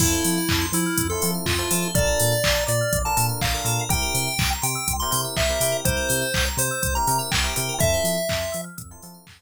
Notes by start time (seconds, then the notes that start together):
0.00 F2 C4 E4 F4 A4, kick, crash
0.12 C5
0.24 F3 E5, open hi-hat
0.38 F5
0.49 F2 A5, kick, clap
0.61 C6
0.72 F3 E4 E6, open hi-hat
0.86 F6
0.98 F2 E6, kick, closed hi-hat
1.10 C4 E4 F4 A4 C6
1.21 F3 C4 E4 F4 A4 A5, open hi-hat
1.34 F5
1.46 F2 F4 E5, kick, clap
1.59 C4 E4 F4 A4 C5
1.70 F3 C4 E4 F4 A4, open hi-hat
1.82 C5
1.95 A#1 D4 F4 A4 A#4 D5, kick, closed hi-hat
2.07 A#4
2.20 A#2 D5, open hi-hat
2.32 F5
2.44 A#1 A5, kick, clap
2.56 A#5
2.67 A#2 D5 D6, open hi-hat
2.81 F6
2.93 A#1 D6, kick, closed hi-hat
3.05 D4 F4 A4 A#4 A5 A#5
3.17 A#2 D4 F4 A4 A#4 A5, open hi-hat
3.29 F5
3.41 A#1 D5 F5, kick, clap
3.52 D4 F4 A4 A#4
3.64 A#2 D4 F4 A4 A#4, open hi-hat
3.79 A#4
3.89 C2 C4 E4 G4 A#4 G5, kick, closed hi-hat
4.02 A#4
4.14 C3 C5, open hi-hat
4.27 E5
4.38 C2 G5, kick, clap
4.53 A#5
4.62 C3 G5 C6, open hi-hat
4.75 E6
4.88 C2 C6, kick, closed hi-hat
4.99 C4 E4 G4 A#4 A#5 C6
5.11 C3 C4 E4 G4 A#4 G5, open hi-hat
5.24 E5
5.37 C2 C5 E5, kick, clap
5.49 C4 E4 G4 A#4
5.60 C3 C4 E4 G4 A#4, open hi-hat
5.72 A#4
5.85 C2 C4 E4 G4 A#4 C5, kick, closed hi-hat
5.97 A#4
6.09 C3 C5, open hi-hat
6.21 E5
6.34 C2 G5, kick, clap
6.46 A#5
6.57 C3 C5 C6, open hi-hat
6.71 E6
6.82 C2 C6, kick, closed hi-hat
6.95 C4 E4 G4 A#4 A#5
7.07 C3 C4 E4 G4 A#4 G5, open hi-hat
7.19 E5
7.31 C2 C5 G5, kick, clap
7.43 C4 E4 G4 A#4
7.56 C3 C4 E4 G4 A#4, open hi-hat
7.69 A#4
7.79 F2 C4 E4 F4 A4 E5, kick, closed hi-hat
7.93 C5
8.04 F3 E5, open hi-hat
8.17 F5
8.29 F2 A5, kick, clap
8.41 C6
8.52 F3 E6, open hi-hat
8.64 F6
8.77 F2 E6, kick, closed hi-hat
8.91 C4 E4 F4 A4 C6
9.02 F3 C4 E4 F4 A4 A5, open hi-hat
9.14 F5
9.27 F2 E5, kick, clap
9.39 C4 E4 F4 A4 C5